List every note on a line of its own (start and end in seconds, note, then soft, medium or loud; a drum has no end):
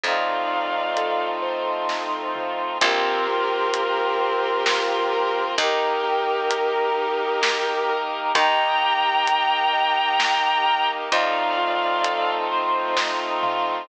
0.03 2.58 F2 medium
0.03 2.78 A3 medium
0.03 2.78 C4 medium
0.03 2.78 D#4 medium
0.03 1.89 D#4 medium
0.03 2.78 F4 medium
0.03 1.25 D5 medium
0.03 1.25 F5 medium
0.03 kick loud
0.03 closed hi-hat medium
0.51 2.34 F4 medium
0.97 2.73 A4 medium
0.97 closed hi-hat loud
1.42 2.74 C5 medium
1.89 2.77 D#4 medium
1.89 kick medium
1.89 snare medium
2.35 2.79 F4 medium
2.35 mid tom loud
2.81 5.36 A#1 loud
2.81 5.55 A#3 medium
2.81 3.27 C4 loud
2.81 5.55 C4 loud
2.81 5.55 F4 loud
2.81 5.41 G4 loud
2.81 5.41 A#4 loud
2.81 kick loud
2.81 closed hi-hat loud
3.28 3.74 F4 medium
3.74 4.20 A#4 medium
3.74 closed hi-hat loud
4.20 4.66 C4 loud
4.66 5.13 F4 loud
4.66 snare loud
5.13 5.57 A#4 loud
5.58 8.13 D#2 medium
5.58 8.33 A#3 medium
5.58 6.04 D#4 loud
5.58 8.33 D#4 medium
5.58 8.33 G4 medium
5.58 7.93 G4 medium
5.58 7.93 A#4 loud
5.58 kick loud
5.58 closed hi-hat loud
6.04 6.50 G4 loud
6.50 6.96 A#4 loud
6.50 closed hi-hat loud
6.98 7.44 D#4 medium
7.42 7.88 G4 loud
7.42 snare loud
7.89 8.33 A#4 loud
8.35 10.90 D#2 loud
8.35 11.09 A#3 loud
8.35 11.09 D#4 loud
8.35 8.83 D#4 loud
8.35 11.09 G4 loud
8.35 10.87 G5 loud
8.35 10.87 A#5 loud
8.35 kick loud
8.35 closed hi-hat loud
8.82 9.28 G4 medium
9.27 9.73 A#4 medium
9.27 closed hi-hat loud
9.73 10.19 D#4 loud
10.19 10.66 G4 medium
10.19 snare loud
10.66 11.10 A#4 loud
11.12 13.67 F2 loud
11.12 13.86 A3 medium
11.12 13.86 C4 medium
11.12 13.86 D#4 loud
11.12 11.59 D#4 loud
11.12 13.86 F4 loud
11.12 12.31 D5 medium
11.12 12.31 F5 medium
11.12 kick loud
11.12 closed hi-hat loud
11.58 12.04 F4 medium
12.03 12.49 A4 loud
12.03 closed hi-hat loud
12.51 12.98 C5 loud
12.97 13.43 D#4 loud
12.97 kick loud
12.97 snare loud
13.43 13.87 F4 loud
13.43 mid tom loud